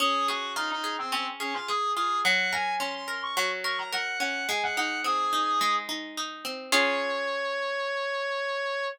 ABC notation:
X:1
M:4/4
L:1/16
Q:1/4=107
K:Db
V:1 name="Clarinet"
A2 G2 E E2 C C z D F A2 A2 | g2 a2 c' c'2 d' d' z d' b g2 g2 | a g g2 A6 z6 | d16 |]
V:2 name="Acoustic Guitar (steel)"
D2 A2 F2 A2 D2 A2 A2 F2 | G,2 B2 D2 B2 G,2 B2 B2 D2 | A,2 E2 C2 E2 A,2 E2 E2 C2 | [DFA]16 |]